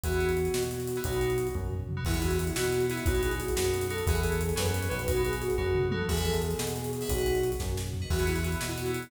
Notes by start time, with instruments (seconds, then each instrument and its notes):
0.04 synth bass 1 E2, electric piano 2 B3 E4 F#4 G#4, flute F#4, kick, closed hi-hat
0.12 closed hi-hat
0.21 closed hi-hat
0.29 closed hi-hat
0.37 closed hi-hat
0.45 closed hi-hat
0.54 synth bass 1 B2, snare
0.63 closed hi-hat
0.71 flute F#4, closed hi-hat
0.80 closed hi-hat
0.87 closed hi-hat
0.96 electric piano 2 B3 E4 F#4 G#4, closed hi-hat
1.04 synth bass 1 B1, electric piano 2 B3 D#4 F#4, flute F#4, kick, closed hi-hat
1.13 closed hi-hat
1.21 closed hi-hat
1.30 closed hi-hat
1.38 closed hi-hat
1.47 closed hi-hat
1.55 synth bass 1 F#2, kick, high tom
1.71 floor tom
1.89 mid tom
1.97 electric piano 2 B3 D#4 F#4
2.05 synth bass 1 E2, electric piano 2 B3 E4 F#4 G#4, flute E4, kick, crash
2.14 electric piano 2 B3 E4 F#4 G#4, closed hi-hat
2.22 flute F#4, closed hi-hat
2.31 closed hi-hat
2.39 flute E4, closed hi-hat
2.47 closed hi-hat
2.56 synth bass 1 B2, electric piano 2 B3 E4 F#4 G#4, flute F#4, snare
2.64 closed hi-hat
2.73 closed hi-hat
2.80 closed hi-hat
2.89 electric piano 2 B3 E4 F#4 G#4, flute E4, closed hi-hat
2.97 closed hi-hat
3.06 synth bass 1 B1, electric piano 2 B3 D#4 F#4, flute F#4, kick, closed hi-hat
3.14 electric piano 2 B3 D#4 F#4, closed hi-hat
3.23 flute G#4, closed hi-hat
3.31 closed hi-hat
3.40 flute F#4, closed hi-hat
3.48 closed hi-hat
3.56 synth bass 1 F#2, electric piano 2 B3 D#4 F#4, flute F#4, snare
3.64 closed hi-hat
3.74 closed hi-hat
3.81 closed hi-hat
3.90 electric piano 2 B3 D#4 F#4, flute A4, closed hi-hat
3.98 closed hi-hat
4.07 synth bass 1 E2, electric piano 2 B3 E4 F#4 G#4, flute G#4, kick, closed hi-hat
4.15 electric piano 2 B3 E4 F#4 G#4, closed hi-hat
4.23 flute A4, closed hi-hat
4.32 closed hi-hat
4.41 flute G#4, closed hi-hat
4.49 closed hi-hat
4.56 synth bass 1 F#2, electric piano 2 B3 C#4 F#4, flute B4, snare
4.66 closed hi-hat
4.74 closed hi-hat
4.83 closed hi-hat
4.90 synth bass 1 B1, electric piano 2 B3 C#4 F#4, flute B4, closed hi-hat
4.99 closed hi-hat
5.08 electric piano 2 B3 D#4 F#4, flute F#4, kick, closed hi-hat
5.16 electric piano 2 B3 D#4 F#4, closed hi-hat
5.25 flute G#4, closed hi-hat
5.33 closed hi-hat
5.41 flute F#4, closed hi-hat
5.50 closed hi-hat
5.58 synth bass 1 F#2, electric piano 2 B3 D#4 F#4, flute F#4, kick, floor tom
5.75 mid tom
5.91 electric piano 2 B3 D#4 F#4, flute A4, high tom
6.09 synth bass 1 E2, flute G#4, electric piano 2 B4 E5 F#5 G#5, kick, crash
6.17 closed hi-hat
6.25 flute A4, closed hi-hat
6.34 closed hi-hat
6.42 flute G#4, closed hi-hat
6.51 closed hi-hat
6.59 synth bass 1 B2, flute G#4, snare
6.67 closed hi-hat
6.76 closed hi-hat
6.84 closed hi-hat
6.93 flute G#4, closed hi-hat
7.01 electric piano 2 B4 E5 F#5 G#5, open hi-hat
7.09 synth bass 1 B1, flute F#4, electric piano 2 B4 D#5 F#5, kick, closed hi-hat
7.18 closed hi-hat
7.26 closed hi-hat
7.35 closed hi-hat
7.43 closed hi-hat
7.52 closed hi-hat
7.60 synth bass 1 F#2, kick, snare
7.77 snare
7.93 floor tom
8.02 electric piano 2 B4 D#5 F#5
8.10 synth bass 1 E2, electric piano 2 B3 E4 F#4 G#4, flute F#4, kick, crash
8.19 electric piano 2 B3 E4 F#4 G#4, closed hi-hat
8.26 electric piano 2 B3 E4 F#4 G#4, flute E4, closed hi-hat
8.35 electric piano 2 B3 E4 F#4 G#4, closed hi-hat
8.44 electric piano 2 B3 E4 F#4 G#4, closed hi-hat
8.52 closed hi-hat
8.60 synth bass 1 B2, electric piano 2 B3 E4 F#4 G#4, snare
8.69 electric piano 2 B3 E4 F#4 G#4, closed hi-hat
8.77 electric piano 2 B3 E4 F#4 G#4, flute F#4, closed hi-hat
8.86 closed hi-hat
8.94 closed hi-hat
9.03 closed hi-hat